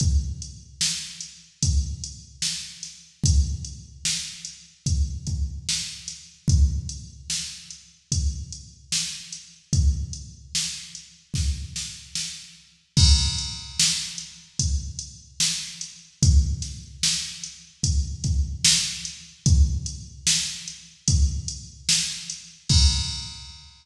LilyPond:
\new DrumStaff \drummode { \time 4/4 \tempo 4 = 74 <hh bd>8 hh8 sn8 hh8 <hh bd>8 hh8 sn8 <hh sn>8 | <hh bd>8 hh8 sn8 hh8 <hh bd>8 <hh bd>8 sn8 <hh sn>8 | <hh bd>8 hh8 sn8 hh8 <hh bd>8 hh8 sn8 hh8 | <hh bd>8 hh8 sn8 hh8 <bd sn>8 sn8 sn4 |
<cymc bd>8 hh8 sn8 hh8 <hh bd>8 hh8 sn8 hh8 | <hh bd>8 <hh sn>8 sn8 hh8 <hh bd>8 <hh bd>8 sn8 hh8 | <hh bd>8 hh8 sn8 hh8 <hh bd>8 hh8 sn8 hh8 | <cymc bd>4 r4 r4 r4 | }